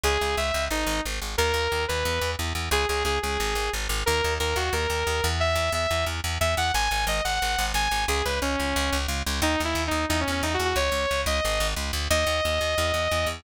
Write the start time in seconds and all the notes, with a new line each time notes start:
0.03 C#2 G#4
0.21 C#2
0.37 C#2 E5
0.54 C#2
0.70 G#1 D#4
0.86 G#1
1.05 G#1
1.22 G#1
1.38 D#2 A#4
1.54 D#2
1.72 D#2
1.88 D#2 B4
2.05 E2
2.21 E2
2.39 E2
2.55 E2
2.71 C#2 G#4
2.89 C#2 G#4
3.05 C#2 G#4
3.22 C#2 G#4
3.40 G#1
3.55 G#1
3.73 G#1
3.89 G#1
4.06 D#2 A#4
4.24 D#2
4.40 D#2 A#4
4.56 D#2 F#4
4.73 D#2 A#4
4.90 D#2
5.07 D#2
5.24 E2
5.40 E5
5.55 E2
5.72 E2 E5
5.91 E2
6.06 E2
6.24 E2
6.41 E2 E5
6.57 E2 F#5
6.74 G#1 G#5
6.91 G#1 G#5
7.07 G#1 D#5
7.24 G#1 F#5
7.42 G#1
7.58 G#1
7.74 G#1 G#5
7.91 G#1
8.08 C#2 G#4
8.25 C#2 B4
8.42 C#2 C#4
8.59 C#2
8.76 C#2
8.92 C#2
9.08 C#2
9.26 C#2
9.42 D#2 D#4
9.60 D#2
9.65 E4
9.75 D#2
9.87 D#2 D#4
10.09 E2 D#4
10.20 C#4
10.28 E2 C#4
10.43 E2 D#4
10.54 F#4
10.59 E2
10.65 F#4
10.76 C#2 C#5
10.92 C#2
11.11 C#2
11.26 C#2 D#5
11.45 G#1
11.60 G#1
11.76 C#2
11.93 D2
12.10 D#2 D#5
12.27 D#2
12.45 D#2
12.61 D#2
12.78 E2
12.94 E2
13.11 E2
13.26 E2